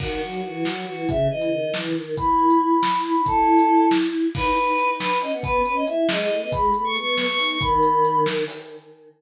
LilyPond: <<
  \new Staff \with { instrumentName = "Choir Aahs" } { \time 5/8 \key b \mixolydian \tempo 4 = 138 fis'4 fis'4 fis'8 | e''8 dis''4 r4 | b''4 b''4 b''8 | a'4. r4 |
b'4. b'8 dis''16 fis''16 | b'8 b'16 dis''16 e''8 dis''16 dis''8 dis''16 | b''8 b''16 cis'''16 cis'''8 cis'''16 cis'''8 cis'''16 | b''4. r4 | }
  \new Staff \with { instrumentName = "Choir Aahs" } { \time 5/8 \key b \mixolydian dis8 fis8 e8 fis8 e8 | cis8 e8 dis8 e8 dis8 | e'4. r16 e'8 dis'16 | e'2~ e'8 |
dis'8 dis'4. cis'16 b16 | b8 cis'8 e'8 gis8 a16 b16 | gis8 a16 a16 b8. b16 dis'8 | dis2 r8 | }
  \new DrumStaff \with { instrumentName = "Drums" } \drummode { \time 5/8 <cymc bd>8. hh8. sn4 | <hh bd>8. hh8. sn4 | <hh bd>8. hh8. sn4 | <hh bd>8. hh8. sn4 |
<cymc bd>8 hh8 hh8 sn8 hho8 | <hh bd>8 hh8 hh8 sn8 hh8 | <hh bd>8 hh8 hh8 sn8 hho8 | <hh bd>8 hh8 hh8 sn8 hho8 | }
>>